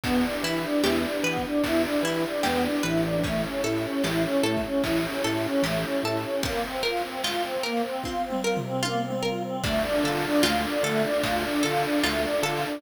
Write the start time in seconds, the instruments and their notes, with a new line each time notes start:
0.04 drawbar organ E2, choir aahs B3, pad 5 (bowed) D4 E4 G4 B4, pizzicato strings D4, kick, ride
0.24 choir aahs D4
0.43 drawbar organ E3, choir aahs E4, pizzicato strings E4
0.57 ride
0.64 choir aahs D4
0.84 drawbar organ E2, choir aahs E4, pizzicato strings G4, snare
1.04 choir aahs D4
1.23 drawbar organ E3, choir aahs B3, pizzicato strings B4
1.37 kick, ride
1.44 choir aahs D4
1.64 drawbar organ E2, pizzicato strings D4, choir aahs E4, kick, ride
1.84 choir aahs D4
2.03 drawbar organ E3, choir aahs E4, pizzicato strings E4
2.17 ride
2.24 choir aahs D4
2.43 drawbar organ E2, choir aahs B3, pizzicato strings G4, snare
2.63 choir aahs D4
2.83 drawbar organ A1, choir aahs E4, pizzicato strings B4
2.97 ride
3.04 choir aahs D4
3.23 choir aahs A3, pad 5 (bowed) C#4 E4 G4 A4, pizzicato strings C#4, kick, ride
3.43 choir aahs C#4
3.64 drawbar organ A2, choir aahs E4, pizzicato strings A4
3.77 ride
3.84 choir aahs C#4
4.04 drawbar organ A1, choir aahs E4, pizzicato strings G4, snare
4.24 choir aahs C#4
4.43 drawbar organ A2, choir aahs A3, pizzicato strings A4
4.57 kick, ride
4.64 choir aahs C#4
4.84 drawbar organ A1, pizzicato strings C#4, choir aahs E4, kick, ride
5.03 choir aahs C#4
5.24 drawbar organ A2, choir aahs E4, pizzicato strings A4
5.37 ride
5.44 choir aahs C#4
5.62 drawbar organ A1, choir aahs A3, pizzicato strings G4, snare
5.84 choir aahs C#4
6.03 drawbar organ A2, choir aahs E4, pizzicato strings A4
6.17 ride
6.24 choir aahs C#4
6.43 choir aahs A#3, pizzicato strings C4, kick, ride
6.64 choir aahs C4
6.83 choir aahs F4, pizzicato strings A#4
6.97 ride
7.03 choir aahs C4
7.24 choir aahs F4, pizzicato strings F4, snare
7.44 choir aahs C4
7.63 choir aahs A#3, pizzicato strings A#4
7.77 ride
7.84 choir aahs C4
8.04 pizzicato strings C4, choir aahs F4, kick, high tom
8.24 choir aahs C4
8.30 mid tom
8.43 choir aahs F4, pizzicato strings A#4
8.57 floor tom
8.64 choir aahs C4
8.83 choir aahs A#3, pizzicato strings F4, high tom
9.04 choir aahs C4
9.10 mid tom
9.23 choir aahs F4, pizzicato strings A#4
9.43 choir aahs C4
9.64 drawbar organ D2, choir aahs A3, pizzicato strings D4, pad 5 (bowed) D4 F4 A4, kick, crash
9.84 choir aahs D4
10.04 drawbar organ D3, choir aahs F4, pizzicato strings A4
10.17 ride
10.24 choir aahs D4
10.43 drawbar organ D2, pizzicato strings F4, choir aahs F4, snare
10.64 choir aahs D4
10.83 drawbar organ D3, choir aahs A3, pizzicato strings A4
10.97 ride
11.04 choir aahs D4
11.23 drawbar organ D2, pizzicato strings D4, choir aahs F4, kick, ride
11.44 choir aahs D4
11.63 drawbar organ D3, choir aahs F4, pizzicato strings A4
11.77 ride
11.84 choir aahs D4
12.04 drawbar organ D2, choir aahs A3, pizzicato strings F4, snare
12.24 choir aahs D4
12.43 drawbar organ D3, choir aahs F4, pizzicato strings A4
12.57 ride
12.64 choir aahs D4